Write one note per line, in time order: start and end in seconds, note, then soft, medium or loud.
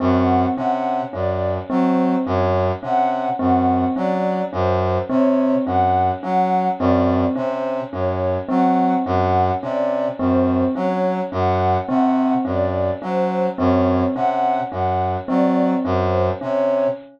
0.00 0.46 F#2 medium
0.00 0.46 C4 medium
0.00 0.45 F#5 medium
0.57 1.02 C3 medium
0.57 1.03 C#4 medium
0.57 1.02 F#5 medium
1.13 1.58 F#2 medium
1.13 1.58 C#4 medium
1.13 1.58 D5 medium
1.70 2.15 F#3 medium
1.70 2.15 C4 medium
1.70 2.15 C5 medium
2.26 2.71 F#2 medium
2.26 2.72 C#4 medium
2.26 2.72 C#5 medium
2.83 3.28 C3 medium
2.83 3.28 C#4 medium
2.83 3.28 F#5 medium
3.39 3.85 F#2 medium
3.39 3.85 C4 medium
3.39 3.85 F#5 medium
3.96 4.42 F#3 medium
3.96 4.41 C#4 medium
3.96 4.42 D5 medium
4.53 4.98 F#2 medium
4.53 4.98 C#4 medium
4.53 4.98 C5 medium
5.09 5.55 C3 medium
5.09 5.55 C4 medium
5.09 5.55 C#5 medium
5.66 6.11 F#2 medium
5.66 6.12 C#4 medium
5.66 6.11 F#5 medium
6.23 6.68 F#3 medium
6.23 6.68 C#4 medium
6.23 6.68 F#5 medium
6.79 7.25 F#2 medium
6.79 7.25 C4 medium
6.79 7.25 D5 medium
7.36 7.81 C3 medium
7.36 7.81 C#4 medium
7.36 7.81 C5 medium
7.92 8.38 F#2 medium
7.92 8.38 C#4 medium
7.92 8.38 C#5 medium
8.49 8.94 F#3 medium
8.49 8.94 C4 medium
8.49 8.94 F#5 medium
9.06 9.51 F#2 medium
9.06 9.51 C#4 medium
9.06 9.51 F#5 medium
9.62 10.08 C3 medium
9.62 10.08 C#4 medium
9.62 10.08 D5 medium
10.19 10.64 F#2 medium
10.19 10.65 C4 medium
10.19 10.64 C5 medium
10.75 11.21 F#3 medium
10.75 11.21 C#4 medium
10.75 11.21 C#5 medium
11.32 11.77 F#2 medium
11.32 11.77 C#4 medium
11.32 11.77 F#5 medium
11.88 12.34 C3 medium
11.88 12.34 C4 medium
11.88 12.34 F#5 medium
12.45 12.90 F#2 medium
12.45 12.90 C#4 medium
12.45 12.91 D5 medium
13.02 13.47 F#3 medium
13.02 13.47 C#4 medium
13.02 13.47 C5 medium
13.58 14.04 F#2 medium
13.58 14.04 C4 medium
13.58 14.04 C#5 medium
14.15 14.60 C3 medium
14.15 14.61 C#4 medium
14.15 14.60 F#5 medium
14.72 15.17 F#2 medium
14.72 15.17 C#4 medium
14.72 15.17 F#5 medium
15.28 15.74 F#3 medium
15.28 15.73 C4 medium
15.28 15.74 D5 medium
15.85 16.30 F#2 medium
15.85 16.30 C#4 medium
15.85 16.30 C5 medium
16.41 16.87 C3 medium
16.41 16.87 C#4 medium
16.41 16.87 C#5 medium